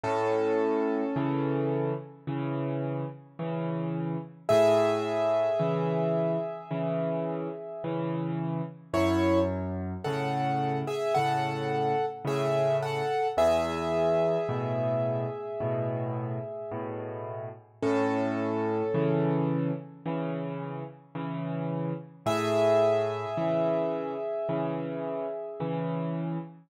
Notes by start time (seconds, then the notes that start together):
0.03 A2 C#4 A4
1.16 C#3 E3
2.27 C#3 E3
3.39 C#3 E3
4.49 A2 G#4 E5
5.59 C#3 E3
6.71 C#3 E3
7.84 C#3 E3
8.93 F#2 E4 C#5
10.04 A2 C#3 A4 F#5
10.87 G#4 E5
11.14 A2 C#3 A4 F#5
12.25 A2 C#3 G#4 E5
12.82 A4 F#5
13.37 E2 G#4 E5
14.49 A2 B2
15.60 A2 B2
16.71 A2 B2
17.82 A2 C#4 A4
18.94 C#3 E3
20.06 C#3 E3
21.15 C#3 E3
22.26 A2 G#4 E5
23.37 C#3 E3
24.49 C#3 E3
25.60 C#3 E3